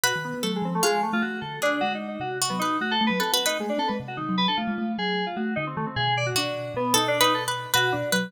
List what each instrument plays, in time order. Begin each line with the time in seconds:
0.03 kalimba B2, electric piano 2 F#4, harpsichord B4
0.16 kalimba D#3
0.25 electric piano 2 B3
0.34 kalimba B3
0.43 kalimba F#3, electric piano 2 A3, harpsichord A4
0.56 electric piano 2 G#3
0.62 kalimba F3, electric piano 2 C4
0.75 electric piano 2 A3
0.83 electric piano 2 G#3, harpsichord F4
1.03 electric piano 2 A3
1.13 kalimba A3, electric piano 2 F4
1.22 kalimba A3, electric piano 2 F#4
1.41 kalimba D3, electric piano 2 A4
1.62 electric piano 2 D4, harpsichord G#4
1.81 kalimba G#3, electric piano 2 F#4
1.95 electric piano 2 D#4
2.08 electric piano 2 D#4
2.20 kalimba C3, electric piano 2 F#4
2.42 harpsichord F#4
2.50 kalimba F#3, electric piano 2 B3
2.59 electric piano 2 D#4, harpsichord B4
2.81 kalimba A3, electric piano 2 F#4
2.91 electric piano 2 A4
3.01 kalimba A3
3.07 kalimba F#3, electric piano 2 B4
3.19 kalimba C4, electric piano 2 A4, harpsichord B4
3.32 electric piano 2 F#4, harpsichord B4
3.46 electric piano 2 D#4, harpsichord B4
3.59 electric piano 2 G#3, kalimba A3
3.69 electric piano 2 D4
3.78 kalimba C4, electric piano 2 A4
3.88 kalimba G#3, electric piano 2 B4
4.00 kalimba C3
4.08 electric piano 2 F#4
4.17 kalimba D#3, electric piano 2 D#4
4.29 kalimba F#3
4.38 electric piano 2 B4
4.48 kalimba D4, electric piano 2 A4
4.57 kalimba A3, electric piano 2 F4
4.68 kalimba G#3
4.78 kalimba A3
4.98 kalimba F#3, electric piano 2 G#4
5.26 electric piano 2 F4
5.36 kalimba A3, electric piano 2 F#4
5.56 kalimba D3, electric piano 2 D#4
5.67 electric piano 2 C4
5.77 kalimba D#3, electric piano 2 A3
5.86 electric piano 2 C4
5.96 kalimba B2, electric piano 2 G#4
6.17 electric piano 2 D5
6.26 electric piano 2 F#4
6.35 kalimba B2, electric piano 2 D4, harpsichord F#4
6.74 kalimba B2, electric piano 2 B3
6.94 kalimba B2, electric piano 2 D#4, harpsichord A4
7.08 electric piano 2 D4
7.21 electric piano 2 D#4, harpsichord B4
7.34 electric piano 2 A4
7.48 harpsichord B4
7.74 kalimba B2, electric piano 2 F#4, harpsichord B4
7.92 kalimba B2, electric piano 2 D4
8.12 kalimba F#3, harpsichord B4